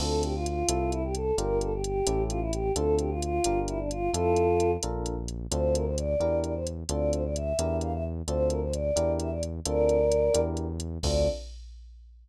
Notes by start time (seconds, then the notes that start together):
0.00 D2 C4 D4 F4 A4, crash
0.23 G4, closed hi-hat
0.35 F4
0.46 F4, closed hi-hat
0.68 C2 C4 E4 A4, closed hi-hat
0.92 E4, closed hi-hat
1.03 G4
1.15 A4, closed hi-hat
1.38 G1 D4 F4 G4 A#4, closed hi-hat
1.61 A4, closed hi-hat
1.74 G4
1.83 G4, closed hi-hat
2.07 A1 C#4 E4 G4 A4, closed hi-hat
2.29 F4, closed hi-hat
2.41 E4
2.52 G4, closed hi-hat
2.76 D2 C4 D4 F4 A4, closed hi-hat
2.99 G4, closed hi-hat
3.10 F4
3.22 F4, closed hi-hat
3.44 G1 D4 F4 G4 A#4, closed hi-hat
3.68 E4, closed hi-hat
3.78 D4
3.91 F4, closed hi-hat
4.13 F2 C4 E4 F4 A4, closed hi-hat
4.36 closed hi-hat
4.60 closed hi-hat
4.83 A#1 D4 F4 A4 A#4, closed hi-hat
5.06 closed hi-hat
5.28 closed hi-hat
5.51 D2 C4 D4 F4 A4 C5, closed hi-hat
5.74 A#4, closed hi-hat
5.85 C5
5.97 D5, closed hi-hat
6.20 E2 D4 E4 G4 A#4, closed hi-hat
6.43 D5, closed hi-hat
6.55 C5
6.67 closed hi-hat
6.89 D2 C4 D4 F4 A4 D5, closed hi-hat
7.12 C5, closed hi-hat
7.24 D5
7.35 E5, closed hi-hat
7.59 E2 D4 E4 G4 A#4, closed hi-hat
7.81 F5, closed hi-hat
7.93 E5
8.28 D2 C4 D4 F4 A4 C5, closed hi-hat
8.49 A#4, closed hi-hat
8.62 C5
8.73 D5, closed hi-hat
8.96 E2 D4 E4 G4 A#4, closed hi-hat
9.20 E5, closed hi-hat
9.31 D5
9.43 closed hi-hat
9.66 D2 C4 D4 F4 A4 A#4 D5, closed hi-hat
9.89 closed hi-hat
10.12 closed hi-hat
10.34 E2 D4 E4 G4 A#4, closed hi-hat
10.57 closed hi-hat
10.80 closed hi-hat
11.03 D2 C4 D4 F4 A4 D5, kick, crash